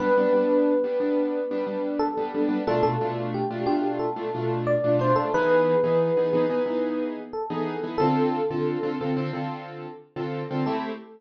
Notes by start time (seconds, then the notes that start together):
0.00 G3 B3 D4 B4
0.18 G3 B3 D4
0.33 G3 B3 D4
0.84 G3 B3 D4
1.00 G3 B3 D4
1.51 G3 B3 D4
1.67 G3 B3 D4
1.99 A4
2.17 G3 B3 D4
2.34 G3 B3 D4
2.49 G3 B3 D4
2.67 B2 A3 D4 F4 A4
2.83 B2 A3 D4 F4 A4
3.01 B2 A3 D4 F4
3.34 G4
3.51 B2 A3 D4 F4
3.66 B2 A3 D4 F4 G4
3.99 A4
4.16 B2 A3 D4 F4
4.34 B2 A3 D4 F4
4.67 D5
4.84 B2 A3 D4 F4
4.99 B2 A3 D4 F4 C5
5.16 B2 A3 D4 F4 A4
5.34 E3 B3 D#4 G#4 B4
5.84 E3 B3 D#4 G#4
6.17 E3 B3 D#4 G#4
6.33 E3 B3 D#4 G#4
6.50 E3 B3 D#4 G#4
6.66 E3 B3 D#4 G#4
7.33 A4
7.50 E3 B3 D#4 G#4
7.83 E3 B3 D#4 G#4
7.98 D3 C4 F4 A4
8.51 D3 C4 F4 A4
8.83 D3 C4 F4 A4
9.01 D3 C4 F4 A4
9.17 D3 C4 F4 A4
9.33 D3 C4 F4 A4
10.16 D3 C4 F4 A4
10.51 D3 C4 F4 A4
10.66 A3 C4 E4 G4 A4